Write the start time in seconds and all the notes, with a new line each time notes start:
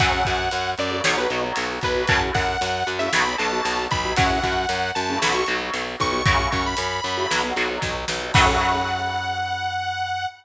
0.00 F#2 C#3 F#3 A3 F#5, kick, closed hi-hat
0.25 F#2, kick, closed hi-hat
0.51 F#2, closed hi-hat
0.78 F#2 D5, closed hi-hat
0.91 C#3 F#3 A3
1.04 B1 B2 F#3 C#5, snare
1.17 B2 F#3 B4
1.30 B1 B2 F#3, closed hi-hat
1.44 B2 F#3
1.56 B1, closed hi-hat
1.81 B1 B4, kick, closed hi-hat
1.96 B2 F#3
2.07 F#2 A2 C#3 F#3 A5, kick, closed hi-hat
2.34 F#2 F#5, kick, closed hi-hat
2.61 F#2, closed hi-hat
2.87 F#2, closed hi-hat
2.99 A2 C#3 F#3 E5
3.13 B1 B2 F#3 B5, snare
3.27 B2 F#3
3.38 B1 B2 F#3 A5, closed hi-hat
3.52 B2 F#3
3.65 B1, closed hi-hat
3.91 B1 B5, kick, closed hi-hat
4.05 B2 F#3
4.16 F#2 A2 C#3 F#3 F#5, kick, closed hi-hat
4.43 F#2, kick, closed hi-hat
4.69 F#2, closed hi-hat
4.95 F#2 A5, closed hi-hat
5.09 A2 C#3 F#3
5.22 B1 B2 F#3 B5, snare
5.34 B2 F#3 C#6
5.46 B1 B2 F#3, closed hi-hat
5.61 B2 F#3
5.74 B1, closed hi-hat
6.00 B1 C#6, kick, closed hi-hat
6.12 B2 F#3
6.26 F#2 A2 C#3 F#3 C#6, kick, closed hi-hat
6.52 F#2 C#6, kick, closed hi-hat
6.66 B5
6.77 F#2, closed hi-hat
7.04 F#2, closed hi-hat
7.17 A2 C#3 F#3
7.31 B1 B2 F#3, snare
7.43 B2 F#3
7.56 B1 B2 F#3, closed hi-hat
7.70 B2 F#3
7.82 B1, kick, snare
8.08 B1, snare
8.22 B2 F#3
8.34 F#2 C#3 F#3 A3 F#5, kick, crash